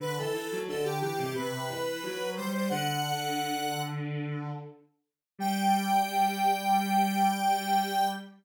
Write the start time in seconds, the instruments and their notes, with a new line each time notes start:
0.00 violin D3, lead 1 (square) B4
0.17 violin E3, lead 1 (square) A4
0.33 violin E3
0.51 violin F#3
0.67 violin D3, lead 1 (square) A4
0.84 lead 1 (square) G4
1.01 violin E3, lead 1 (square) G4
1.18 violin C3
1.34 violin C3, lead 1 (square) B4
1.52 violin C3
1.69 violin E3
2.03 violin F#3
2.20 violin F#3
2.36 violin G3, lead 1 (square) C5
2.53 lead 1 (square) C5
2.69 violin D3, lead 1 (square) F#5
5.38 violin G3, lead 1 (square) G5